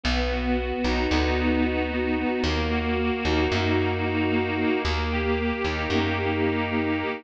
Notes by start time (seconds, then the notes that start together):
0.04 B1 B3
0.31 F#4
0.57 B3
0.84 B1 D#4
1.11 D2 B3
1.38 F#4
1.65 D#4
1.91 B3
2.18 B3
2.44 D#2 A#3
2.71 F#4
2.97 A#3
3.25 D#2 D#4
3.52 F#2 A#3
3.79 F#4
4.05 D#4
4.30 A#3
4.57 A#3
4.85 D#2 A#3
5.11 G4
5.39 A#3
5.64 D#2 D#4
5.90 F#2 A#3
6.18 G4
6.45 D#4
6.70 A#3
6.98 A#3